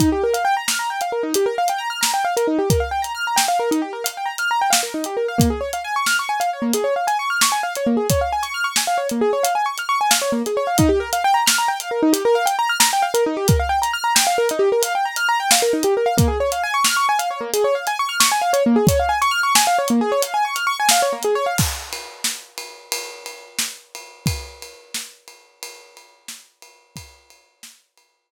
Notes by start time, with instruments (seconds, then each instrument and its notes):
0.00 acoustic grand piano D#4, kick, closed hi-hat
0.12 acoustic grand piano G4
0.24 acoustic grand piano A#4
0.34 acoustic grand piano F5, closed hi-hat
0.45 acoustic grand piano G5
0.57 acoustic grand piano A#5
0.68 acoustic grand piano F6, snare
0.79 acoustic grand piano A#5
0.90 acoustic grand piano G5
1.01 acoustic grand piano F5, closed hi-hat
1.12 acoustic grand piano A#4
1.23 acoustic grand piano D#4
1.34 acoustic grand piano G4, closed hi-hat
1.46 acoustic grand piano A#4
1.58 acoustic grand piano F5
1.68 acoustic grand piano G5, closed hi-hat
1.78 acoustic grand piano A#5
1.90 acoustic grand piano F6
2.01 acoustic grand piano A#5, snare
2.14 acoustic grand piano G5
2.25 acoustic grand piano F5
2.37 acoustic grand piano A#4, closed hi-hat
2.47 acoustic grand piano D#4
2.59 acoustic grand piano G4
2.70 acoustic grand piano A#4, kick, closed hi-hat
2.80 acoustic grand piano F5
2.91 acoustic grand piano G5
3.02 acoustic grand piano A#5, closed hi-hat
3.15 acoustic grand piano F6
3.27 acoustic grand piano A#5
3.36 acoustic grand piano G5, snare
3.48 acoustic grand piano F5
3.59 acoustic grand piano A#4
3.71 acoustic grand piano D#4, closed hi-hat
3.82 acoustic grand piano G4
3.93 acoustic grand piano A#4
4.04 acoustic grand piano F5, closed hi-hat
4.17 acoustic grand piano G5
4.26 acoustic grand piano A#5
4.38 acoustic grand piano F6, closed hi-hat
4.51 acoustic grand piano A#5
4.61 acoustic grand piano G5
4.70 acoustic grand piano F5, snare
4.83 acoustic grand piano A#4
4.94 acoustic grand piano D#4
5.04 acoustic grand piano G4, closed hi-hat
5.17 acoustic grand piano A#4
5.28 acoustic grand piano F5
5.38 acoustic grand piano A#3, kick, closed hi-hat
5.50 acoustic grand piano G#4
5.61 acoustic grand piano C#5
5.73 acoustic grand piano F5, closed hi-hat
5.84 acoustic grand piano G#5
5.96 acoustic grand piano C#6
6.06 acoustic grand piano F6, snare
6.19 acoustic grand piano C#6
6.29 acoustic grand piano G#5
6.40 acoustic grand piano F5, closed hi-hat
6.53 acoustic grand piano C#5
6.62 acoustic grand piano A#3
6.73 acoustic grand piano G#4, closed hi-hat
6.84 acoustic grand piano C#5
6.96 acoustic grand piano F5
7.07 acoustic grand piano G#5, closed hi-hat
7.19 acoustic grand piano C#6
7.30 acoustic grand piano F6
7.41 acoustic grand piano C#6, snare
7.52 acoustic grand piano G#5
7.63 acoustic grand piano F5
7.75 acoustic grand piano C#5, closed hi-hat
7.87 acoustic grand piano A#3
7.97 acoustic grand piano G#4
8.10 acoustic grand piano C#5, kick, closed hi-hat
8.21 acoustic grand piano F5
8.32 acoustic grand piano G#5
8.43 acoustic grand piano C#6, closed hi-hat
8.54 acoustic grand piano F6
8.64 acoustic grand piano C#6
8.76 acoustic grand piano G#5, snare
8.87 acoustic grand piano F5
8.98 acoustic grand piano C#5
9.09 acoustic grand piano A#3, closed hi-hat
9.21 acoustic grand piano G#4
9.33 acoustic grand piano C#5
9.43 acoustic grand piano F5, closed hi-hat
9.55 acoustic grand piano G#5
9.66 acoustic grand piano C#6
9.78 acoustic grand piano F6, closed hi-hat
9.89 acoustic grand piano C#6
10.01 acoustic grand piano G#5
10.11 acoustic grand piano F5, snare
10.22 acoustic grand piano C#5
10.32 acoustic grand piano A#3
10.46 acoustic grand piano G#4, closed hi-hat
10.57 acoustic grand piano C#5
10.67 acoustic grand piano F5
10.78 acoustic grand piano D#4, kick, closed hi-hat
10.89 acoustic grand piano G4
11.00 acoustic grand piano A#4
11.13 acoustic grand piano F5, closed hi-hat
11.24 acoustic grand piano G5
11.34 acoustic grand piano A#5
11.46 acoustic grand piano F6, snare
11.58 acoustic grand piano A#5
11.68 acoustic grand piano G5
11.80 acoustic grand piano F5, closed hi-hat
11.91 acoustic grand piano A#4
12.03 acoustic grand piano D#4
12.13 acoustic grand piano G4, closed hi-hat
12.25 acoustic grand piano A#4
12.35 acoustic grand piano F5
12.46 acoustic grand piano G5, closed hi-hat
12.59 acoustic grand piano A#5
12.69 acoustic grand piano F6
12.80 acoustic grand piano A#5, snare
12.93 acoustic grand piano G5
13.02 acoustic grand piano F5
13.14 acoustic grand piano A#4, closed hi-hat
13.26 acoustic grand piano D#4
13.37 acoustic grand piano G4
13.48 acoustic grand piano A#4, kick, closed hi-hat
13.59 acoustic grand piano F5
13.69 acoustic grand piano G5
13.82 acoustic grand piano A#5, closed hi-hat
13.93 acoustic grand piano F6
14.04 acoustic grand piano A#5
14.15 acoustic grand piano G5, snare
14.27 acoustic grand piano F5
14.38 acoustic grand piano A#4
14.49 acoustic grand piano D#4, closed hi-hat
14.59 acoustic grand piano G4
14.72 acoustic grand piano A#4
14.83 acoustic grand piano F5, closed hi-hat
14.95 acoustic grand piano G5
15.05 acoustic grand piano A#5
15.16 acoustic grand piano F6, closed hi-hat
15.29 acoustic grand piano A#5
15.40 acoustic grand piano G5
15.51 acoustic grand piano F5, snare
15.62 acoustic grand piano A#4
15.73 acoustic grand piano D#4
15.83 acoustic grand piano G4, closed hi-hat
15.97 acoustic grand piano A#4
16.06 acoustic grand piano F5
16.17 acoustic grand piano A#3, kick, closed hi-hat
16.28 acoustic grand piano G#4
16.40 acoustic grand piano C#5
16.52 acoustic grand piano F5, closed hi-hat
16.63 acoustic grand piano G#5
16.74 acoustic grand piano C#6
16.84 acoustic grand piano F6, snare
16.97 acoustic grand piano C#6
17.09 acoustic grand piano G#5
17.19 acoustic grand piano F5, closed hi-hat
17.31 acoustic grand piano C#5
17.41 acoustic grand piano A#3
17.53 acoustic grand piano G#4, closed hi-hat
17.64 acoustic grand piano C#5
17.75 acoustic grand piano F5
17.87 acoustic grand piano G#5, closed hi-hat
17.99 acoustic grand piano C#6
18.09 acoustic grand piano F6
18.20 acoustic grand piano C#6, snare
18.32 acoustic grand piano G#5
18.42 acoustic grand piano F5
18.53 acoustic grand piano C#5, closed hi-hat
18.66 acoustic grand piano A#3
18.76 acoustic grand piano G#4
18.87 acoustic grand piano C#5, kick, closed hi-hat
18.99 acoustic grand piano F5
19.09 acoustic grand piano G#5
19.22 acoustic grand piano C#6, closed hi-hat
19.31 acoustic grand piano F6
19.43 acoustic grand piano C#6
19.55 acoustic grand piano G#5, snare
19.67 acoustic grand piano F5
19.78 acoustic grand piano C#5
19.88 acoustic grand piano A#3, closed hi-hat
20.01 acoustic grand piano G#4
20.12 acoustic grand piano C#5
20.22 acoustic grand piano F5, closed hi-hat
20.34 acoustic grand piano G#5
20.45 acoustic grand piano C#6
20.55 acoustic grand piano F6, closed hi-hat
20.67 acoustic grand piano C#6
20.80 acoustic grand piano G#5
20.89 acoustic grand piano F5, snare
21.02 acoustic grand piano C#5
21.13 acoustic grand piano A#3
21.23 acoustic grand piano G#4, closed hi-hat
21.35 acoustic grand piano C#5
21.46 acoustic grand piano F5
21.58 kick, crash
21.93 ride
22.24 snare
22.58 ride
22.92 ride
23.26 ride
23.59 snare
23.95 ride
24.26 kick, ride
24.62 ride
24.94 snare
25.28 ride
25.63 ride
25.97 ride
26.28 snare
26.62 ride
26.96 kick, ride
27.30 ride
27.63 snare
27.97 ride